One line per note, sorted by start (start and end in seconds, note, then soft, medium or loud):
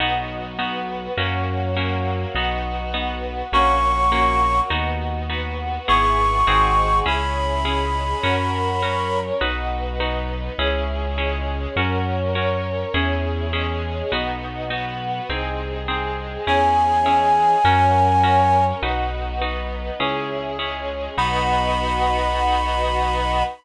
0.00 1.08 B1 loud
0.00 0.53 B3 loud
0.00 0.58 B3 medium
0.00 0.53 D#4 loud
0.00 0.59 D#4 medium
0.00 0.53 F#4 loud
0.00 0.58 F#4 medium
0.58 1.16 B3 medium
0.58 1.12 B3 loud
0.58 1.12 D#4 medium
0.58 1.16 F#4 medium
0.58 1.12 F#4 loud
0.58 1.16 B4 medium
1.17 2.26 F#2 medium
1.17 1.75 A#3 medium
1.17 1.70 A#3 loud
1.17 1.75 C#4 medium
1.17 1.70 C#4 loud
1.17 1.75 F#4 medium
1.17 1.70 F#4 loud
1.76 2.35 F#3 medium
1.76 2.29 A#3 loud
1.76 2.35 A#3 medium
1.76 2.29 C#4 medium
1.76 2.29 F#4 medium
1.76 2.35 F#4 medium
2.35 3.43 B1 medium
2.35 2.88 B3 loud
2.35 2.94 B3 medium
2.35 2.88 D#4 loud
2.35 2.94 D#4 medium
2.35 2.88 F#4 loud
2.35 2.94 F#4 medium
2.94 3.47 B3 loud
2.94 3.52 B3 medium
2.94 3.47 D#4 loud
2.94 3.47 F#4 medium
2.94 3.51 F#4 medium
2.94 3.52 B4 medium
3.52 4.61 A#1 loud
3.52 4.10 A#3 medium
3.52 4.06 A#3 loud
3.52 4.10 C#4 medium
3.52 4.06 C#4 loud
3.52 4.10 F#4 medium
3.52 4.06 F#4 loud
3.52 4.61 C#6 medium
4.12 4.70 F#3 medium
4.12 4.70 A#3 medium
4.12 4.65 A#3 loud
4.12 4.65 C#4 loud
4.12 4.70 F#4 medium
4.12 4.65 F#4 loud
4.70 5.79 D#2 medium
4.70 5.23 B3 loud
4.70 5.28 B3 medium
4.70 5.23 D#4 loud
4.70 5.30 D#4 medium
4.70 5.23 F#4 loud
4.70 5.28 F#4 medium
5.28 5.86 B3 medium
5.28 5.82 B3 medium
5.28 5.82 D#4 loud
5.28 5.86 F#4 medium
5.28 5.82 F#4 medium
5.28 5.86 B4 medium
5.87 6.43 G#1 loud
5.87 6.46 B3 medium
5.87 6.41 B3 loud
5.87 6.46 E4 medium
5.87 6.41 E4 loud
5.87 6.46 G#4 medium
5.87 6.41 G#4 loud
5.87 6.99 C#6 medium
6.47 7.01 G#1 loud
6.47 7.00 C4 loud
6.47 7.06 C4 medium
6.47 7.00 D#4 loud
6.47 7.06 D#4 medium
6.47 7.00 F#4 loud
6.47 7.06 F#4 medium
6.47 7.00 G#4 loud
6.47 7.06 G#4 medium
7.06 8.14 C#2 medium
7.06 7.59 C#4 loud
7.06 7.64 C#4 medium
7.06 7.59 E4 loud
7.06 7.65 E4 medium
7.06 7.59 G#4 loud
7.06 7.64 G#4 medium
7.06 9.20 B5 medium
7.65 8.23 G#3 medium
7.65 8.23 C#4 medium
7.65 8.18 C#4 medium
7.65 8.18 E4 loud
7.65 8.23 G#4 medium
7.65 8.18 G#4 loud
8.23 9.32 F#2 loud
8.23 8.76 C#4 loud
8.23 8.82 C#4 medium
8.23 8.76 F#4 loud
8.23 8.82 F#4 medium
8.23 8.76 A#4 loud
8.23 8.82 A#4 medium
8.82 9.35 C#4 medium
8.82 9.41 C#4 medium
8.82 9.35 F#4 medium
8.82 9.35 A#4 loud
8.82 9.41 A#4 medium
8.82 9.41 C#5 medium
9.41 10.50 B1 loud
9.41 9.94 D#4 loud
9.41 10.00 D#4 medium
9.41 9.94 F#4 loud
9.41 10.00 F#4 medium
9.41 9.94 B4 loud
9.41 10.00 B4 medium
10.00 10.58 B3 medium
10.00 10.53 D#4 loud
10.00 10.58 D#4 medium
10.00 10.53 F#4 loud
10.00 10.53 B4 loud
10.00 10.58 B4 medium
10.58 11.67 C#2 loud
10.58 11.17 C#4 medium
10.58 11.12 C#4 loud
10.58 11.17 E4 medium
10.58 11.12 E4 loud
10.58 11.17 G#4 medium
10.58 11.12 G#4 loud
11.18 11.76 G#3 medium
11.18 11.71 C#4 loud
11.18 11.76 C#4 medium
11.18 11.71 E4 loud
11.18 11.71 G#4 medium
11.18 11.76 G#4 medium
11.76 12.85 F#2 loud
11.76 12.35 C#4 medium
11.76 12.30 C#4 loud
11.76 12.35 F#4 medium
11.76 12.30 F#4 loud
11.76 12.35 A#4 medium
11.76 12.30 A#4 loud
12.35 12.88 C#4 medium
12.35 12.94 C#4 medium
12.35 12.88 F#4 loud
12.35 12.88 A#4 loud
12.35 12.94 A#4 medium
12.35 12.94 C#5 medium
12.94 14.02 E2 loud
12.94 13.47 C#4 loud
12.94 13.52 C#4 medium
12.94 13.47 E4 loud
12.94 13.52 E4 medium
12.94 13.47 G#4 loud
12.94 13.52 G#4 medium
13.53 14.11 G#3 medium
13.53 14.11 C#4 medium
13.53 14.06 C#4 loud
13.53 14.06 E4 loud
13.53 14.11 G#4 medium
13.53 14.06 G#4 loud
14.12 15.20 B1 loud
14.12 14.65 B3 loud
14.12 14.71 B3 medium
14.12 14.65 D#4 loud
14.12 14.71 D#4 medium
14.12 14.65 F#4 loud
14.12 14.71 F#4 medium
14.70 15.23 B3 medium
14.70 15.29 B3 medium
14.70 15.23 D#4 medium
14.70 15.23 F#4 loud
14.70 15.29 F#4 medium
14.70 15.29 B4 medium
15.29 16.38 C2 medium
15.29 15.87 C4 medium
15.29 15.82 C4 loud
15.29 15.87 D#4 medium
15.29 15.82 D#4 loud
15.29 15.87 G#4 medium
15.29 15.82 G#4 loud
15.88 16.47 G#3 medium
15.88 16.41 C4 loud
15.88 16.47 C4 medium
15.88 16.41 D#4 medium
15.88 16.41 G#4 loud
15.88 16.47 G#4 medium
16.47 17.55 E2 loud
16.47 17.00 C#4 loud
16.47 17.06 C#4 medium
16.47 17.00 E4 loud
16.47 17.06 E4 medium
16.47 17.00 G#4 loud
16.47 17.06 G#4 medium
16.47 18.64 G#5 medium
17.06 17.64 G#3 medium
17.06 17.59 C#4 medium
17.06 17.64 C#4 medium
17.06 17.59 E4 loud
17.06 17.59 G#4 medium
17.06 17.64 G#4 medium
17.64 18.73 F#2 loud
17.64 18.23 C#4 medium
17.64 18.18 C#4 loud
17.64 18.23 F#4 medium
17.64 18.18 F#4 loud
17.64 18.23 A#4 medium
17.64 18.18 A#4 loud
18.23 18.76 C#4 medium
18.23 18.82 C#4 medium
18.23 18.76 F#4 medium
18.23 18.76 A#4 medium
18.23 18.82 A#4 medium
18.23 18.82 C#5 medium
18.82 19.91 B1 medium
18.82 19.40 D#4 medium
18.82 19.36 D#4 loud
18.82 19.40 F#4 medium
18.82 19.36 F#4 loud
18.82 19.40 B4 medium
18.82 19.36 B4 loud
19.41 19.99 B3 medium
19.41 19.99 D#4 medium
19.41 19.94 D#4 loud
19.41 19.94 F#4 loud
19.41 19.99 B4 medium
19.41 19.94 B4 loud
20.00 21.08 C#2 medium
20.00 20.53 C#4 loud
20.00 20.57 C#4 medium
20.00 20.53 E4 loud
20.00 20.59 E4 medium
20.00 20.53 G#4 loud
20.00 20.57 G#4 medium
20.58 21.16 G#3 medium
20.58 21.16 C#4 medium
20.58 21.12 C#4 loud
20.58 21.12 E4 medium
20.58 21.16 G#4 medium
20.58 21.12 G#4 medium
21.17 23.43 B1 loud
21.17 23.43 B3 loud
21.17 23.43 D#4 loud
21.17 23.43 F#4 loud
21.17 23.43 B5 loud